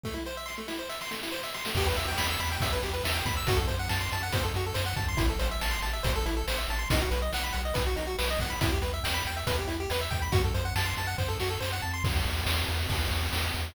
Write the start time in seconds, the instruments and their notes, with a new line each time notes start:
0.04 lead 1 (square) A3, kick, snare
0.14 lead 1 (square) E4
0.26 lead 1 (square) C5, snare
0.37 lead 1 (square) E5
0.46 lead 1 (square) C6, snare
0.58 lead 1 (square) A3
0.68 lead 1 (square) E4, snare
0.79 lead 1 (square) C5
0.89 lead 1 (square) E5, snare
1.01 lead 1 (square) C6, snare
1.11 lead 1 (square) A3, snare
1.23 lead 1 (square) E4, snare
1.32 lead 1 (square) C5, snare
1.43 lead 1 (square) E5, snare
1.54 lead 1 (square) C6, snare
1.65 lead 1 (square) A3, snare
1.75 synth bass 1 E2, lead 1 (square) G4, kick, crash
1.86 lead 1 (square) B4
1.96 synth bass 1 E2, lead 1 (square) E5, closed hi-hat
2.08 lead 1 (square) G5
2.18 synth bass 1 E2, lead 1 (square) B5, snare
2.30 lead 1 (square) E6
2.40 synth bass 1 E2, lead 1 (square) B5, closed hi-hat
2.52 lead 1 (square) G5
2.60 synth bass 1 E2, lead 1 (square) E5, kick, closed hi-hat
2.72 lead 1 (square) B4
2.82 synth bass 1 E2, lead 1 (square) G4, closed hi-hat
2.94 lead 1 (square) B4
3.04 synth bass 1 E2, lead 1 (square) E5, snare
3.14 lead 1 (square) G5
3.26 synth bass 1 E2, lead 1 (square) B5, kick, closed hi-hat
3.37 lead 1 (square) E6
3.47 synth bass 1 F#2, lead 1 (square) F#4, kick, closed hi-hat
3.57 lead 1 (square) A4
3.67 synth bass 1 F#2, lead 1 (square) C5, closed hi-hat
3.79 lead 1 (square) F#5
3.89 synth bass 1 F#2, lead 1 (square) A5, snare
4.01 lead 1 (square) C6
4.11 synth bass 1 F#2, lead 1 (square) A5, closed hi-hat
4.23 lead 1 (square) F#5
4.33 synth bass 1 F#2, lead 1 (square) C5, kick, closed hi-hat
4.43 lead 1 (square) A4
4.54 synth bass 1 F#2, lead 1 (square) F#4, closed hi-hat
4.66 lead 1 (square) A4
4.74 synth bass 1 F#2, lead 1 (square) C5, snare
4.86 lead 1 (square) F#5
4.96 synth bass 1 F#2, lead 1 (square) A5, kick, closed hi-hat
5.08 lead 1 (square) C6
5.17 synth bass 1 A1, lead 1 (square) E4, kick, closed hi-hat
5.30 lead 1 (square) A4
5.39 synth bass 1 A1, lead 1 (square) C5, closed hi-hat
5.51 lead 1 (square) E5
5.61 synth bass 1 A1, lead 1 (square) A5, snare
5.71 lead 1 (square) C6
5.82 synth bass 1 A1, lead 1 (square) A5, closed hi-hat
5.93 lead 1 (square) E5
6.03 synth bass 1 A1, lead 1 (square) C5, kick, closed hi-hat
6.16 lead 1 (square) A4
6.26 synth bass 1 A1, lead 1 (square) E4, closed hi-hat
6.37 lead 1 (square) A4
6.48 synth bass 1 A1, lead 1 (square) C5, snare
6.58 lead 1 (square) E5
6.68 synth bass 1 A1, lead 1 (square) A5, closed hi-hat
6.79 lead 1 (square) C6
6.90 synth bass 1 B1, lead 1 (square) D#4, kick, closed hi-hat
7.00 lead 1 (square) F#4
7.11 synth bass 1 B1, lead 1 (square) B4, closed hi-hat
7.22 lead 1 (square) D#5
7.33 synth bass 1 B1, lead 1 (square) F#5, snare
7.43 lead 1 (square) B5
7.52 synth bass 1 B1, lead 1 (square) F#5, closed hi-hat
7.65 lead 1 (square) D#5
7.74 synth bass 1 B1, lead 1 (square) B4, kick, closed hi-hat
7.86 lead 1 (square) F#4
7.96 synth bass 1 B1, lead 1 (square) D#4, closed hi-hat
8.07 lead 1 (square) F#4
8.18 synth bass 1 B1, lead 1 (square) B4, snare
8.30 lead 1 (square) D#5
8.39 synth bass 1 B1, lead 1 (square) F#5, kick, open hi-hat
8.50 lead 1 (square) B5
8.61 synth bass 1 E2, lead 1 (square) E4, kick, closed hi-hat
8.72 lead 1 (square) G4
8.82 synth bass 1 E2, lead 1 (square) B4, closed hi-hat
8.94 lead 1 (square) E5
9.04 synth bass 1 E2, lead 1 (square) G5, snare
9.14 lead 1 (square) B5
9.25 synth bass 1 E2, lead 1 (square) G5, closed hi-hat
9.37 lead 1 (square) E5
9.47 synth bass 1 E2, lead 1 (square) B4, kick, closed hi-hat
9.58 lead 1 (square) G4
9.68 synth bass 1 E2, lead 1 (square) E4, closed hi-hat
9.80 lead 1 (square) G4
9.90 synth bass 1 E2, lead 1 (square) B4, snare
10.01 lead 1 (square) E5
10.11 synth bass 1 E2, lead 1 (square) G5, kick, closed hi-hat
10.22 lead 1 (square) B5
10.32 synth bass 1 F#2, lead 1 (square) F#4, kick, closed hi-hat
10.44 lead 1 (square) A4
10.54 synth bass 1 F#2, lead 1 (square) C5, closed hi-hat
10.65 lead 1 (square) F#5
10.76 synth bass 1 F#2, lead 1 (square) A5, snare
10.85 lead 1 (square) C6
10.97 synth bass 1 F#2, lead 1 (square) A5, closed hi-hat
11.07 lead 1 (square) F#5
11.18 synth bass 1 F#2, lead 1 (square) C5, kick, snare
11.28 lead 1 (square) A4
11.40 synth bass 1 F#2, lead 1 (square) F#4, snare
11.50 lead 1 (square) A4
11.60 synth bass 1 F#2, lead 1 (square) C5, snare
11.72 lead 1 (square) F#5
11.82 synth bass 1 F2, lead 1 (square) A5
11.94 lead 1 (square) C6
12.04 synth bass 1 E2, kick, crash
12.25 synth bass 1 E2, ride
12.46 synth bass 1 E2, snare
12.69 synth bass 1 E2, ride
12.89 synth bass 1 E2, kick, ride
13.11 synth bass 1 E2, ride
13.33 synth bass 1 E2, snare
13.53 synth bass 1 E2, ride